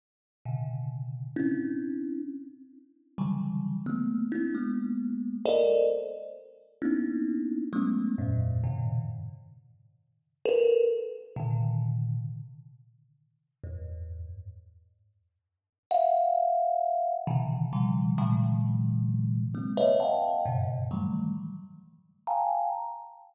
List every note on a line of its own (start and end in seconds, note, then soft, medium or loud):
0.45 1.27 A2 medium
0.45 1.27 B2 medium
0.45 1.27 C#3 medium
0.45 1.27 D3 medium
1.36 2.18 C4 medium
1.36 2.18 C#4 medium
1.36 2.18 D4 medium
1.36 2.18 E4 medium
3.18 3.80 C#3 medium
3.18 3.80 D3 medium
3.18 3.80 E3 medium
3.18 3.80 F#3 medium
3.18 3.80 G3 medium
3.86 4.27 A3 medium
3.86 4.27 A#3 medium
3.86 4.27 B3 medium
4.32 4.52 C4 medium
4.32 4.52 D4 medium
4.32 4.52 E4 medium
4.55 5.36 G#3 medium
4.55 5.36 A#3 medium
4.55 5.36 B3 medium
5.45 5.86 A4 loud
5.45 5.86 A#4 loud
5.45 5.86 C5 loud
5.45 5.86 D5 loud
5.45 5.86 D#5 loud
6.82 7.64 A#3 medium
6.82 7.64 B3 medium
6.82 7.64 C#4 medium
6.82 7.64 D4 medium
6.82 7.64 D#4 medium
6.82 7.64 E4 medium
7.73 8.14 F#3 medium
7.73 8.14 G#3 medium
7.73 8.14 A3 medium
7.73 8.14 B3 medium
7.73 8.14 C#4 medium
8.18 8.59 F2 medium
8.18 8.59 G2 medium
8.18 8.59 G#2 medium
8.18 8.59 A2 medium
8.18 8.59 A#2 medium
8.64 9.05 F#2 medium
8.64 9.05 G#2 medium
8.64 9.05 A#2 medium
8.64 9.05 B2 medium
8.64 9.05 C#3 medium
8.64 9.05 D#3 medium
10.45 10.86 A4 loud
10.45 10.86 A#4 loud
10.45 10.86 B4 loud
11.36 12.18 A#2 medium
11.36 12.18 C3 medium
11.36 12.18 D3 medium
11.36 12.18 D#3 medium
13.64 14.25 E2 soft
13.64 14.25 F#2 soft
13.64 14.25 G#2 soft
15.91 17.14 E5 loud
15.91 17.14 F5 loud
15.91 17.14 F#5 loud
17.27 17.68 B2 medium
17.27 17.68 C3 medium
17.27 17.68 C#3 medium
17.27 17.68 D3 medium
17.27 17.68 D#3 medium
17.27 17.68 E3 medium
17.73 18.14 B2 medium
17.73 18.14 C#3 medium
17.73 18.14 D#3 medium
17.73 18.14 F3 medium
17.73 18.14 G3 medium
18.18 19.41 A#2 loud
18.18 19.41 C3 loud
18.18 19.41 D3 loud
18.18 19.41 E3 loud
18.18 19.41 F#3 loud
18.18 19.41 G#3 loud
19.55 19.75 G#3 medium
19.55 19.75 A#3 medium
19.55 19.75 C4 medium
19.77 19.98 B4 medium
19.77 19.98 C#5 medium
19.77 19.98 D#5 medium
19.77 19.98 E5 medium
20.00 20.41 D#5 medium
20.00 20.41 F5 medium
20.00 20.41 F#5 medium
20.00 20.41 G5 medium
20.00 20.41 A5 medium
20.45 20.86 F#2 medium
20.45 20.86 G2 medium
20.45 20.86 A2 medium
20.45 20.86 B2 medium
20.45 20.86 C#3 medium
20.91 21.32 D#3 medium
20.91 21.32 E3 medium
20.91 21.32 F#3 medium
20.91 21.32 G3 medium
20.91 21.32 A3 medium
22.27 22.68 F5 medium
22.27 22.68 G5 medium
22.27 22.68 G#5 medium
22.27 22.68 A5 medium
22.27 22.68 A#5 medium